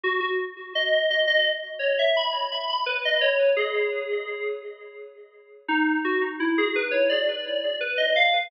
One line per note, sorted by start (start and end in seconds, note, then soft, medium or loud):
0.04 0.20 F#4 loud
0.20 0.37 F#4 loud
0.75 1.04 D#5 loud
1.10 1.27 D#5 loud
1.27 1.44 D#5 loud
1.79 1.96 C#5 medium
1.99 2.16 E5 loud
2.16 2.49 B5 loud
2.52 2.68 B5 medium
2.69 2.86 B5 loud
2.86 3.03 B4 loud
3.05 3.22 D#5 loud
3.21 3.49 C#5 medium
3.56 4.44 G#4 medium
5.68 5.98 D#4 loud
6.04 6.21 F#4 medium
6.40 6.57 E4 loud
6.58 6.75 G#4 loud
6.76 6.92 B4 loud
6.91 7.08 C#5 medium
7.09 7.76 D5 medium
7.81 7.97 B4 loud
7.97 8.14 D#5 medium
8.16 8.47 F5 loud